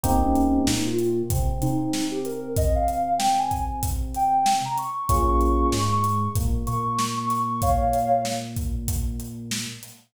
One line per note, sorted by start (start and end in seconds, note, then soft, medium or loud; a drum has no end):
0.04 0.59 C2 medium
0.04 0.62 A#3 medium
0.04 0.62 C4 loud
0.04 0.22 C4 loud
0.04 0.62 D#4 medium
0.04 0.62 G4 medium
0.04 kick medium
0.04 closed hi-hat medium
0.23 0.60 C#4 loud
0.36 closed hi-hat medium
0.67 1.23 A#2 medium
0.67 1.22 A#3 medium
0.67 0.86 D#4 loud
0.67 snare loud
0.86 1.16 F4 loud
0.99 closed hi-hat medium
1.30 1.59 C3 medium
1.30 1.59 C4 medium
1.30 kick medium
1.30 closed hi-hat medium
1.62 4.60 C3 medium
1.62 4.59 C4 medium
1.62 2.10 D#4 loud
1.62 closed hi-hat medium
1.93 snare medium
2.11 2.23 G4 medium
2.25 2.54 A#4 medium
2.25 closed hi-hat medium
2.57 2.75 D#5 loud
2.57 kick loud
2.57 closed hi-hat medium
2.75 3.13 F5 loud
2.88 closed hi-hat medium
3.18 3.36 G5 loud
3.18 snare loud
3.39 3.64 G#5 medium
3.51 kick medium
3.51 closed hi-hat medium
3.83 kick medium
3.83 closed hi-hat medium
4.15 4.56 G5 loud
4.15 closed hi-hat medium
4.46 snare loud
4.65 4.77 A#5 medium
4.78 5.05 C#6 medium
4.78 closed hi-hat medium
5.09 5.65 A#1 medium
5.09 5.67 A#3 medium
5.09 5.67 C#4 medium
5.09 5.67 F4 medium
5.09 5.67 G#4 medium
5.09 5.27 C#6 loud
5.09 kick medium
5.09 closed hi-hat medium
5.28 5.67 C#6 loud
5.41 closed hi-hat medium
5.72 6.28 G#2 medium
5.72 6.28 G#3 medium
5.72 5.90 C#6 medium
5.72 snare loud
5.92 6.18 C#6 loud
6.04 closed hi-hat medium
6.36 6.64 A#2 medium
6.36 6.63 A#3 medium
6.36 kick medium
6.36 closed hi-hat medium
6.67 9.66 A#2 medium
6.67 9.64 A#3 medium
6.67 7.08 C#6 medium
6.67 closed hi-hat medium
6.99 snare medium
7.17 7.29 C#6 loud
7.30 7.61 C#6 medium
7.30 snare soft
7.30 closed hi-hat medium
7.62 8.21 C#5 loud
7.62 8.21 F5 loud
7.62 kick medium
7.62 closed hi-hat medium
7.93 closed hi-hat medium
8.25 snare medium
8.57 kick medium
8.57 closed hi-hat medium
8.88 kick medium
8.88 closed hi-hat medium
9.20 closed hi-hat medium
9.51 snare loud
9.83 snare soft
9.83 closed hi-hat medium